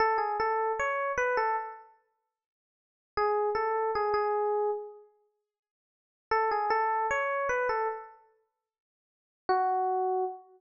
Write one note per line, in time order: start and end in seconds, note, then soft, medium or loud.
0.00 0.19 A4 loud
0.18 0.37 G#4 medium
0.40 0.72 A4 medium
0.79 1.12 C#5 medium
1.18 1.36 B4 medium
1.37 1.56 A4 medium
3.17 3.50 G#4 medium
3.55 3.91 A4 medium
3.95 4.13 G#4 medium
4.14 4.71 G#4 medium
6.31 6.50 A4 medium
6.51 6.70 G#4 medium
6.70 7.07 A4 medium
7.11 7.48 C#5 medium
7.49 7.68 B4 medium
7.69 7.88 A4 medium
9.49 10.24 F#4 medium